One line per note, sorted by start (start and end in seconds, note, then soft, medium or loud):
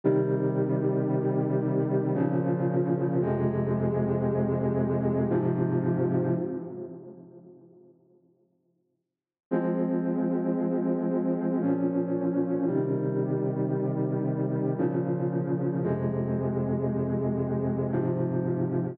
0.04 2.13 C3 medium
0.04 2.13 D#3 medium
0.04 2.13 G3 medium
2.14 3.18 A#2 medium
2.14 3.18 C#3 medium
2.14 3.18 F3 medium
3.21 5.29 F2 medium
3.21 5.29 C3 medium
3.21 5.29 G#3 loud
5.30 6.34 G#2 medium
5.30 6.34 C3 loud
5.30 6.34 F3 loud
9.51 11.59 F3 medium
9.51 11.59 G#3 medium
9.51 11.59 C4 medium
11.61 12.65 A#2 medium
11.61 12.65 F3 medium
11.61 12.65 C#4 medium
12.67 14.75 C3 medium
12.67 14.75 D#3 medium
12.67 14.75 G3 medium
14.78 15.82 A#2 medium
14.78 15.82 C#3 medium
14.78 15.82 F3 medium
15.83 17.91 F2 medium
15.83 17.91 C3 medium
15.83 17.91 G#3 medium
17.92 18.96 G#2 medium
17.92 18.96 C3 medium
17.92 18.96 F3 medium